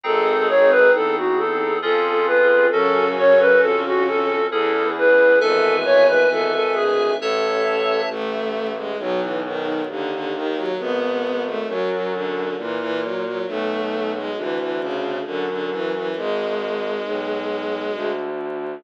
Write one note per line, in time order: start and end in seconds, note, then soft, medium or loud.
0.04 0.84 G#1 loud
0.04 0.92 G#3 medium
0.04 1.79 C4 medium
0.04 1.79 D#4 medium
0.04 1.79 G#4 medium
0.04 0.92 G#4 medium
0.04 0.48 A4 medium
0.49 0.70 C#5 medium
0.71 0.92 B4 loud
0.93 1.74 E2 medium
0.93 1.16 A4 medium
1.17 1.39 F#4 medium
1.38 1.78 A4 medium
1.82 2.65 F2 loud
1.82 2.70 C#4 medium
1.82 2.70 F4 medium
1.82 2.70 G#4 medium
1.82 2.26 A4 medium
2.27 2.67 B4 medium
2.71 3.53 F#2 loud
2.71 4.35 C#3 medium
2.71 4.48 C#4 medium
2.71 4.35 C#4 medium
2.71 4.48 F#4 medium
2.71 3.08 A4 loud
2.71 4.48 A4 medium
3.18 3.40 C#5 loud
3.40 3.61 B4 medium
3.61 4.43 F2 medium
3.61 3.82 A4 medium
3.85 4.06 F#4 medium
4.07 4.47 A4 medium
4.50 5.34 E2 loud
4.50 4.91 E2 medium
4.50 4.91 E3 medium
4.50 5.39 C#4 medium
4.50 5.39 E4 medium
4.50 5.39 G#4 medium
4.50 4.88 A4 medium
4.96 5.36 E2 medium
4.96 5.36 E3 medium
4.96 5.39 B4 medium
5.40 6.21 G#1 loud
5.40 6.52 E2 medium
5.40 6.52 E3 medium
5.40 5.76 A4 loud
5.40 7.16 B4 medium
5.40 7.16 E5 medium
5.40 7.16 G#5 medium
5.85 6.07 C#5 loud
6.07 6.29 B4 medium
6.31 7.11 G#1 medium
6.31 6.53 A4 medium
6.54 6.75 A4 medium
6.74 7.12 D2 medium
6.74 7.12 D3 medium
6.74 7.10 G#4 medium
7.20 8.02 A1 loud
7.20 8.01 A4 medium
7.20 8.09 C#5 medium
7.20 8.09 E5 medium
7.20 8.09 A5 medium
8.10 8.92 A1 loud
8.10 8.71 A3 loud
8.76 8.97 G#3 medium
8.99 9.80 B1 loud
8.99 9.20 F#3 loud
9.20 9.41 E3 medium
9.45 9.82 D#3 loud
9.89 10.69 D#2 medium
9.89 10.11 D3 loud
10.12 10.33 D3 loud
10.34 10.56 D#3 loud
10.56 10.77 F#3 loud
10.79 11.61 G#1 loud
10.79 11.43 B3 loud
11.45 11.67 A3 loud
11.68 12.49 F#2 loud
11.68 11.89 F#3 loud
11.91 12.12 F#3 medium
12.13 12.56 D3 medium
12.57 13.38 A#2 medium
12.57 12.78 E3 loud
12.79 13.00 E3 loud
13.01 13.23 F#3 medium
13.24 13.45 F#3 medium
13.47 14.28 B1 loud
13.47 14.11 A3 loud
14.15 14.36 G#3 loud
14.37 15.17 D2 loud
14.37 14.58 E3 loud
14.58 14.79 E3 medium
14.81 15.19 C#3 loud
15.25 16.07 F#2 medium
15.25 15.46 D3 loud
15.49 15.70 D3 medium
15.71 15.92 E3 loud
15.94 16.16 E3 loud
16.16 16.96 G#1 loud
16.16 18.10 G#3 loud
17.06 17.86 B1 medium
17.94 18.75 D2 medium